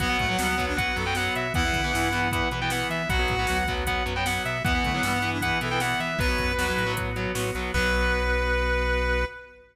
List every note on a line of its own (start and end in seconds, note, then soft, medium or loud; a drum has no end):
0.00 0.16 B1 medium
0.00 0.07 F#3 loud
0.00 0.07 B3 medium
0.00 0.17 B3 loud
0.00 1.53 B3 medium
0.00 1.53 F#4 medium
0.00 0.65 F#5 loud
0.00 kick loud
0.00 closed hi-hat loud
0.09 0.25 F#3 medium
0.09 0.25 B3 medium
0.19 0.36 A2 medium
0.19 0.28 A3 loud
0.19 kick loud
0.19 closed hi-hat medium
0.29 0.36 F#3 medium
0.29 0.38 F#3 medium
0.29 0.36 B3 medium
0.38 0.88 D2 medium
0.38 0.55 F#3 medium
0.38 0.48 G3 medium
0.38 0.55 B3 medium
0.38 snare loud
0.48 0.65 B3 medium
0.58 0.73 F#3 medium
0.58 0.73 B3 medium
0.58 kick loud
0.58 closed hi-hat medium
0.68 0.77 D4 loud
0.77 0.92 F#3 medium
0.77 0.92 B3 medium
0.77 0.95 B4 medium
0.77 0.96 F#5 loud
0.77 kick loud
0.77 closed hi-hat loud
0.96 1.30 F#2 medium
0.96 1.04 F#3 medium
0.96 1.04 B3 medium
0.96 1.14 A4 medium
0.96 closed hi-hat medium
1.06 1.13 F#3 medium
1.06 1.13 B3 medium
1.06 1.15 G5 medium
1.15 1.47 F#3 medium
1.15 1.47 B3 medium
1.15 1.34 F#5 loud
1.15 snare loud
1.35 1.52 B2 medium
1.35 1.53 E5 medium
1.35 closed hi-hat loud
1.54 1.71 E2 medium
1.54 1.62 E3 medium
1.54 1.62 B3 medium
1.54 3.08 B3 medium
1.54 3.08 E4 medium
1.54 2.20 E4 loud
1.54 2.30 F#5 loud
1.54 kick loud
1.54 closed hi-hat loud
1.65 1.80 E3 medium
1.65 1.80 B3 medium
1.73 1.91 D3 medium
1.73 kick loud
1.73 closed hi-hat medium
1.84 1.92 E3 medium
1.84 1.92 B3 medium
1.93 2.43 G2 medium
1.93 2.09 E3 medium
1.93 2.09 B3 medium
1.93 snare loud
2.13 2.28 E3 medium
2.13 2.28 B3 medium
2.13 closed hi-hat medium
2.31 2.48 E3 medium
2.31 2.48 B3 medium
2.31 2.49 F#5 medium
2.31 kick loud
2.31 closed hi-hat loud
2.51 2.84 B2 medium
2.51 2.60 E3 medium
2.51 2.60 B3 medium
2.51 closed hi-hat medium
2.61 2.69 E3 medium
2.61 2.69 B3 medium
2.61 2.71 G5 medium
2.70 3.02 E3 medium
2.70 3.02 B3 medium
2.70 2.87 F#5 medium
2.70 snare loud
2.90 3.06 E3 medium
2.90 3.08 E5 medium
2.90 closed hi-hat medium
3.09 3.26 B1 medium
3.09 3.17 F#3 medium
3.09 3.17 B3 medium
3.09 4.63 B3 medium
3.09 4.63 F#4 medium
3.09 3.58 F#4 medium
3.09 3.73 F#5 loud
3.09 kick loud
3.09 closed hi-hat loud
3.19 3.35 F#3 medium
3.19 3.35 B3 medium
3.28 3.46 A2 medium
3.28 kick loud
3.28 closed hi-hat medium
3.39 3.47 F#3 medium
3.39 3.47 B3 medium
3.47 3.98 D2 medium
3.47 3.63 F#3 medium
3.47 3.63 B3 medium
3.47 snare loud
3.68 3.84 F#3 medium
3.68 3.84 B3 loud
3.68 kick loud
3.68 closed hi-hat medium
3.87 4.03 F#3 medium
3.87 4.03 B3 medium
3.87 4.03 F#5 medium
3.87 kick loud
3.87 closed hi-hat loud
4.06 4.39 F#2 medium
4.06 4.13 F#3 medium
4.06 4.13 B3 medium
4.06 closed hi-hat medium
4.16 4.24 F#3 medium
4.16 4.24 B3 medium
4.16 4.25 G5 loud
4.26 4.58 F#3 medium
4.26 4.58 B3 medium
4.26 4.42 F#5 medium
4.26 snare loud
4.45 4.62 B2 medium
4.45 4.62 E5 medium
4.45 closed hi-hat medium
4.64 4.81 E2 medium
4.64 4.72 E3 loud
4.64 4.72 B3 medium
4.64 6.18 B3 medium
4.64 4.83 B3 medium
4.64 6.18 E4 medium
4.64 5.30 F#5 loud
4.64 kick loud
4.64 closed hi-hat loud
4.75 4.90 E3 medium
4.75 4.90 B3 medium
4.84 5.01 D3 medium
4.84 4.93 A3 medium
4.84 kick medium
4.84 closed hi-hat medium
4.93 5.02 E3 medium
4.93 5.02 F#3 medium
4.93 5.02 B3 medium
5.03 5.52 G2 medium
5.03 5.18 E3 medium
5.03 5.12 G3 loud
5.03 5.18 B3 medium
5.03 snare loud
5.13 5.31 B3 medium
5.22 5.38 E3 medium
5.22 5.38 B3 medium
5.22 closed hi-hat medium
5.33 5.42 D4 medium
5.41 5.58 E3 medium
5.41 5.58 B3 medium
5.41 5.58 B4 medium
5.41 5.60 F#5 medium
5.41 kick loud
5.41 closed hi-hat loud
5.61 5.95 B2 medium
5.61 5.69 E3 medium
5.61 5.69 B3 medium
5.61 5.79 A4 medium
5.61 closed hi-hat loud
5.71 5.79 E3 medium
5.71 5.79 B3 medium
5.71 5.80 G5 loud
5.80 6.12 E3 medium
5.80 6.12 B3 medium
5.80 6.00 F#5 medium
5.80 snare loud
6.00 6.16 E3 medium
6.00 6.19 E5 loud
6.00 closed hi-hat medium
6.19 6.36 B1 medium
6.19 6.26 F#3 loud
6.19 6.26 B3 medium
6.19 7.73 B3 medium
6.19 7.73 F#4 medium
6.19 6.53 B4 loud
6.19 6.92 B4 loud
6.19 kick loud
6.19 closed hi-hat loud
6.28 6.52 F#3 medium
6.28 6.52 B3 medium
6.38 6.55 F#2 medium
6.38 kick loud
6.38 closed hi-hat medium
6.58 6.74 E2 medium
6.58 6.66 F#3 medium
6.58 6.66 B3 medium
6.58 6.94 F#4 medium
6.58 snare loud
6.68 6.84 F#3 medium
6.68 6.84 B3 medium
6.78 7.27 A2 medium
6.78 closed hi-hat medium
6.87 7.10 F#3 medium
6.87 7.10 B3 medium
6.97 kick loud
6.97 closed hi-hat loud
7.16 7.32 F#3 medium
7.16 7.32 B3 medium
7.16 closed hi-hat medium
7.35 7.52 A2 medium
7.35 7.50 F#3 medium
7.35 7.50 B3 medium
7.35 snare loud
7.55 7.71 B1 medium
7.55 7.71 F#3 medium
7.55 7.71 B3 medium
7.55 closed hi-hat medium
7.74 9.25 B1 loud
7.74 9.25 F#3 loud
7.74 9.25 B3 loud
7.74 9.25 B3 medium
7.74 9.25 F#4 medium
7.74 9.25 B4 loud
7.74 kick loud
7.74 crash loud